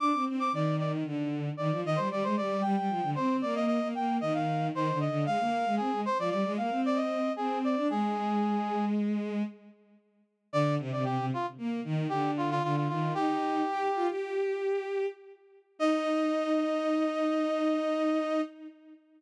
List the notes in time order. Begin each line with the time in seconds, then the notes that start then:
0.00 D4 D6
0.13 C4
0.26 C4
0.40 D6
0.52 D#3 D5
0.79 D5
1.05 D3
1.57 D#3 D5
1.71 F3
1.84 D#3 D#5
1.96 G3 C5
2.10 G3 D5
2.23 G#3 C5
2.37 G3 D5
2.62 G3 G5
2.77 G3
2.89 F3
3.03 D3
3.15 C4 C5
3.42 A#3 D5
3.55 D#5
3.66 D#5
3.81 A#3
3.95 A#3 G5
4.21 D#3 D#5
4.34 F5
4.73 D#3 C5
4.92 D3
5.00 D#5
5.08 D3
5.26 G#3 F5
5.40 A#3
5.66 G#3
5.77 C4 G#4
5.92 G#3
6.05 C5
6.19 F3 D5
6.30 G3 D5
6.45 G#3
6.57 A#3 F5
6.71 C4
6.86 D5
6.96 D#5
7.36 C4 G#4
7.64 D5
7.76 D4
7.90 G#3 G#4
10.53 D3 D5
10.79 C3
10.92 C3 D5
11.04 C3 G4
11.18 C3
11.34 F4
11.58 A#3
11.84 D#3
12.09 D3 G4
12.37 F4
12.51 F4
12.63 D3 F4
12.76 F4
12.88 D#3 F4
13.14 D#4 G4
13.68 G4
13.95 F4
14.08 G4
15.79 D#4 D#5